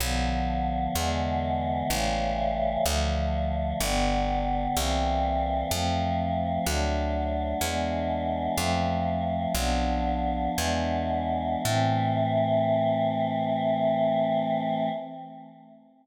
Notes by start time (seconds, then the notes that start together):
0.00 B1 D3 F3 B3
0.95 E2 D3 E3 G#3 B3
1.89 A1 C#3 E3 G3 A3
2.86 D2 D3 F3 A3
3.81 G1 D3 G3 B3
4.76 C2 E3 G3 A#3 C4
5.71 F2 F3 A3 C4
6.66 D2 F#3 A3 D4
7.61 E2 E3 G#3 B3 D4
8.56 F2 F3 A3 C4
9.55 B1 F3 B3 D4
10.56 E2 E3 G#3 B3 D4
11.64 A2 E3 A3 C4